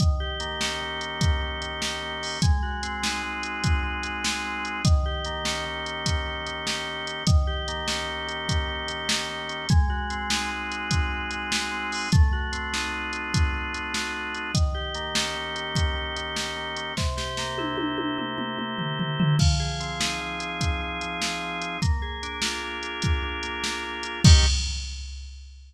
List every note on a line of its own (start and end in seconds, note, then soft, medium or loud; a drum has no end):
0.00 0.81 D#3 medium
0.00 kick medium
0.00 closed hi-hat medium
0.20 1.00 G4 medium
0.40 1.41 A#3 medium
0.40 closed hi-hat medium
0.61 1.21 C#4 medium
0.61 snare medium
0.81 1.61 D#3 medium
1.01 1.81 G4 medium
1.01 closed hi-hat medium
1.21 2.22 C#4 medium
1.21 kick medium
1.21 closed hi-hat medium
1.42 2.02 A#3 medium
1.61 2.38 D#3 medium
1.61 closed hi-hat medium
1.82 2.39 G4 medium
1.82 snare medium
2.02 2.41 A#3 medium
2.22 2.41 C#4 medium
2.22 open hi-hat medium
2.42 3.22 G#3 loud
2.42 kick medium
2.42 closed hi-hat medium
2.63 3.43 F#4 medium
2.83 3.83 C4 medium
2.83 closed hi-hat medium
3.03 3.63 D#4 medium
3.03 snare medium
3.23 4.03 G#3 medium
3.43 4.24 F#4 medium
3.43 closed hi-hat medium
3.63 4.65 D#4 medium
3.63 kick medium
3.63 closed hi-hat medium
3.84 4.44 C4 medium
4.03 4.81 G#3 medium
4.03 closed hi-hat medium
4.24 4.82 F#4 medium
4.24 snare medium
4.45 4.83 C4 medium
4.65 4.84 D#4 medium
4.65 closed hi-hat soft
4.85 5.65 D#3 loud
4.85 kick medium
4.85 closed hi-hat medium
5.06 5.85 G4 medium
5.25 6.26 A#3 medium
5.25 closed hi-hat medium
5.45 6.05 C#4 medium
5.45 snare medium
5.66 6.46 D#3 medium
5.86 6.66 G4 medium
5.86 closed hi-hat soft
6.06 7.06 C#4 medium
6.06 kick medium
6.06 closed hi-hat medium
6.26 6.86 A#3 medium
6.47 7.23 D#3 medium
6.47 closed hi-hat soft
6.66 7.24 G4 medium
6.66 snare medium
6.87 7.25 A#3 medium
7.07 7.26 C#4 medium
7.07 closed hi-hat medium
7.27 8.08 D#3 medium
7.27 kick medium
7.27 closed hi-hat medium
7.47 8.28 G4 medium
7.68 8.68 A#3 medium
7.68 closed hi-hat medium
7.88 8.48 C#4 medium
7.88 snare medium
8.08 8.88 D#3 medium
8.28 9.09 G4 medium
8.28 closed hi-hat soft
8.49 9.49 C#4 medium
8.49 kick medium
8.49 closed hi-hat medium
8.68 9.29 A#3 medium
8.88 9.66 D#3 medium
8.88 closed hi-hat medium
9.09 9.67 G4 medium
9.09 snare medium
9.29 9.68 A#3 medium
9.49 9.69 C#4 medium
9.49 closed hi-hat soft
9.69 10.50 G#3 loud
9.69 kick medium
9.69 closed hi-hat medium
9.90 10.71 F#4 medium
10.10 11.11 C4 medium
10.10 closed hi-hat medium
10.30 10.90 D#4 medium
10.30 snare medium
10.51 11.31 G#3 medium
10.71 11.51 F#4 medium
10.71 closed hi-hat medium
10.91 11.91 D#4 medium
10.91 kick medium
10.91 closed hi-hat medium
11.11 11.71 C4 medium
11.31 12.08 G#3 medium
11.31 closed hi-hat medium
11.51 12.09 F#4 medium
11.51 snare medium
11.72 12.10 C4 medium
11.92 12.11 D#4 medium
11.92 open hi-hat medium
12.12 12.92 A3 loud
12.12 kick medium
12.12 closed hi-hat medium
12.33 13.12 F#4 medium
12.52 13.53 C4 medium
12.52 closed hi-hat medium
12.73 13.32 D#4 medium
12.73 snare medium
12.92 13.74 A3 medium
13.13 13.94 F#4 medium
13.13 closed hi-hat medium
13.33 14.34 D#4 medium
13.33 kick medium
13.33 closed hi-hat medium
13.53 14.13 C4 medium
13.74 14.51 A3 medium
13.74 closed hi-hat medium
13.94 14.52 F#4 medium
13.94 snare medium
14.14 14.52 C4 medium
14.35 14.54 D#4 medium
14.35 closed hi-hat soft
14.54 15.35 D#3 medium
14.54 kick medium
14.54 closed hi-hat medium
14.74 15.55 G4 medium
14.95 15.95 A#3 medium
14.95 closed hi-hat medium
15.15 15.76 C#4 medium
15.15 snare medium
15.36 16.16 D#3 medium
15.56 16.36 G4 medium
15.56 closed hi-hat soft
15.75 16.76 C#4 medium
15.75 kick medium
15.75 closed hi-hat medium
15.96 16.56 A#3 medium
16.16 16.93 D#3 medium
16.16 closed hi-hat medium
16.36 16.94 G4 medium
16.36 snare medium
16.56 16.95 A#3 medium
16.77 16.96 C#4 medium
16.77 closed hi-hat medium
16.97 17.77 C3 loud
16.97 kick medium
16.97 snare medium
17.17 17.97 G4 medium
17.17 snare medium
17.37 18.37 A#3 medium
17.37 snare medium
17.58 18.17 E4 medium
17.58 high tom medium
17.77 18.58 C3 medium
17.77 high tom medium
17.98 18.78 G4 medium
17.98 high tom medium
18.18 19.19 E4 medium
18.18 mid tom medium
18.38 18.99 A#3 medium
18.38 mid tom medium
18.58 19.35 C3 medium
18.58 mid tom medium
18.78 19.36 G4 medium
18.78 floor tom medium
18.99 19.38 A#3 medium
18.99 floor tom medium
19.19 19.39 E4 medium
19.19 floor tom medium
19.39 20.20 F3 medium
19.39 kick medium
19.39 crash medium
19.60 20.40 G#4 medium
19.80 20.81 C4 medium
19.80 closed hi-hat medium
20.00 20.60 D#4 medium
20.00 snare medium
20.21 21.00 F3 medium
20.40 21.21 G#4 medium
20.40 closed hi-hat medium
20.60 21.61 D#4 medium
20.60 kick medium
20.60 closed hi-hat medium
20.81 21.41 C4 medium
21.01 21.77 F3 medium
21.01 closed hi-hat medium
21.21 21.79 G#4 medium
21.21 snare medium
21.42 21.80 C4 medium
21.61 21.80 D#4 medium
21.61 closed hi-hat medium
21.82 22.63 A#3 medium
21.82 kick medium
21.82 closed hi-hat medium
22.02 22.83 G#4 medium
22.23 23.23 D4 medium
22.23 closed hi-hat medium
22.42 23.03 F4 medium
22.42 snare medium
22.63 23.43 A#3 medium
22.83 23.64 G#4 medium
22.83 closed hi-hat soft
23.02 24.04 F4 medium
23.02 kick medium
23.02 closed hi-hat medium
23.23 23.83 D4 medium
23.43 24.20 A#3 medium
23.43 closed hi-hat medium
23.64 24.22 G#4 medium
23.64 snare medium
23.84 24.22 D4 medium
24.03 24.23 F4 medium
24.03 closed hi-hat medium
24.24 24.46 D#3 medium
24.24 24.46 A#3 medium
24.24 24.46 C#4 medium
24.24 24.46 G4 medium
24.24 kick loud
24.24 crash loud